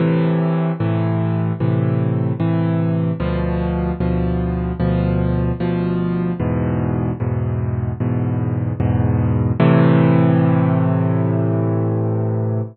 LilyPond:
\new Staff { \clef bass \time 4/4 \key a \minor \tempo 4 = 75 <a, c e>4 <a, c e>4 <a, c e>4 <a, c e>4 | <d, b, f>4 <d, b, f>4 <d, b, f>4 <d, b, f>4 | <e, gis, b,>4 <e, gis, b,>4 <e, gis, b,>4 <e, gis, b,>4 | <a, c e>1 | }